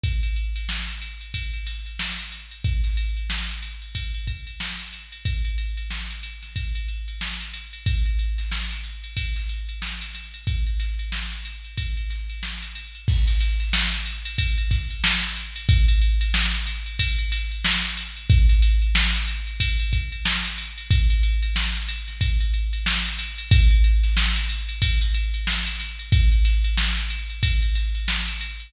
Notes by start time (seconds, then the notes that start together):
0.03 kick, ride
0.23 ride
0.36 ride
0.56 ride
0.69 snare
0.88 ride
1.01 ride
1.21 ride
1.34 kick, ride
1.54 ride
1.67 snare, ride
1.86 ride
1.99 snare
2.19 snare, ride
2.32 ride
2.51 ride
2.64 kick, ride
2.84 snare, ride
2.97 ride
3.17 ride
3.30 snare
3.49 ride
3.62 ride
3.82 ride
3.95 kick, ride
4.14 ride
4.27 kick, ride
4.47 ride
4.60 snare
4.79 ride
4.93 ride
5.12 ride
5.25 kick, ride
5.45 ride
5.58 ride
5.77 ride
5.90 snare
6.10 ride
6.23 ride
6.42 snare, ride
6.56 kick, ride
6.75 ride
6.88 ride
7.08 ride
7.21 snare
7.40 ride
7.54 ride
7.73 ride
7.86 kick, ride
8.06 ride
8.19 ride
8.38 snare, ride
8.51 snare
8.71 ride
8.84 ride
9.04 ride
9.17 kick, ride
9.36 snare, ride
9.49 ride
9.69 ride
9.82 snare
10.01 ride
10.14 snare, ride
10.34 ride
10.47 kick, ride
10.67 ride
10.79 snare, ride
10.99 ride
11.12 snare
11.32 ride
11.45 ride
11.64 ride
11.77 kick, ride
11.97 ride
12.10 snare, ride
12.29 ride
12.43 snare
12.62 ride
12.75 ride
12.95 ride
13.08 kick, crash
13.27 snare, ride
13.40 snare, ride
13.60 snare, ride
13.73 snare
13.93 ride
14.06 ride
14.25 ride
14.38 kick, ride
14.58 ride
14.71 kick, snare, ride
14.90 ride
15.04 snare
15.23 ride
15.36 ride
15.56 ride
15.69 kick, ride
15.88 ride
16.01 ride
16.21 ride
16.34 snare
16.53 ride
16.66 ride
16.86 ride
16.99 kick, ride
17.18 ride
17.32 snare, ride
17.51 ride
17.64 snare
17.84 snare, ride
17.97 ride
18.16 ride
18.30 kick, ride
18.49 snare, ride
18.62 ride
18.82 ride
18.95 snare
19.14 ride
19.28 ride
19.47 ride
19.60 kick, ride
19.79 ride
19.93 kick, ride
20.12 ride
20.25 snare
20.45 ride
20.58 ride
20.77 ride
20.90 kick, ride
21.10 ride
21.23 ride
21.43 ride
21.56 snare
21.75 ride
21.88 ride
22.08 snare, ride
22.21 kick, ride
22.40 ride
22.54 ride
22.73 ride
22.86 snare
23.05 ride
23.19 ride
23.38 ride
23.51 kick, ride
23.71 ride
23.84 ride
24.03 snare, ride
24.17 snare
24.36 ride
24.49 ride
24.69 ride
24.82 kick, ride
25.01 snare, ride
25.14 ride
25.34 ride
25.47 snare
25.66 ride
25.80 snare, ride
25.99 ride
26.12 kick, ride
26.32 ride
26.45 snare, ride
26.64 ride
26.77 snare
26.97 ride
27.10 ride
27.29 ride
27.43 kick, ride
27.62 ride
27.75 snare, ride
27.95 ride
28.08 snare
28.27 ride
28.41 ride
28.60 ride